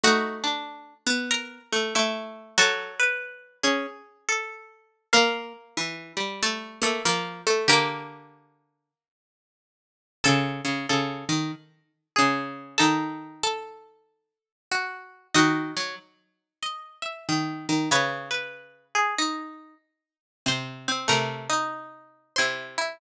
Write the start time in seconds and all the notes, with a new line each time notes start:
0.03 A3 D#4 F#4 F#5
0.44 D4
1.07 B3
1.31 A#4 A#5
1.72 A3
1.95 A3 E4 E5
2.58 F#3 F#4 A4
2.99 B4
3.63 C#4 G#4
4.29 A4
5.13 A#3 A#4 F5
5.77 E3
6.17 G3
6.43 A3 A4
6.82 A3 A#3 A4
7.05 F3 A#3 A#4
7.47 A3 A4
7.68 D3 A#3 G4 A#4
10.24 C#3 A4 A5
10.65 C#3
10.89 C#3 A4
11.29 D#3
12.16 C#3 G#4
12.78 D#3 D#4 A4 A5
13.43 A4 A5
14.72 F#4
15.34 D#3 D#4 F#4 D#5
15.76 F#3
16.63 D#5
17.02 E5
17.29 D#3
17.69 D#3
17.91 C#3 B4 C#5 B5
18.31 B4
18.95 G#4
19.18 D#4
20.46 C3 C5 C6
20.88 C4
21.08 C3 A3 A#4 A#5
21.49 D#4
22.36 C3 E4 C5 C6
22.78 E4